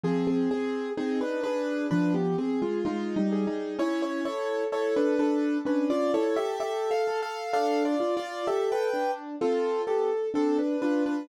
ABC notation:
X:1
M:4/4
L:1/16
Q:1/4=64
K:C
V:1 name="Acoustic Grand Piano"
[C_A] [CA] [CA]2 [CA] [DB] [DB]2 [DB] [B,G] [CA] [_A,F] (3[A,F]2 [G,_E]2 [G,E]2 | [E^c] [Ec] [Ec]2 [Ec] [DB] [DB]2 [DB] [Fd] [Ec] [Ge] (3[Ge]2 [Af]2 [Af]2 | (3[Af]2 [Fd]2 [Fd]2 [Ge] [Bg]2 z [CA]2 [B,G] z [CA] [DB] [DB] [DB] |]
V:2 name="Acoustic Grand Piano"
F,2 _A2 _E2 A2 F,2 A2 E2 A2 | ^C2 A2 A2 A2 C2 A2 A2 A2 | D2 F2 A2 D2 F2 A2 D2 F2 |]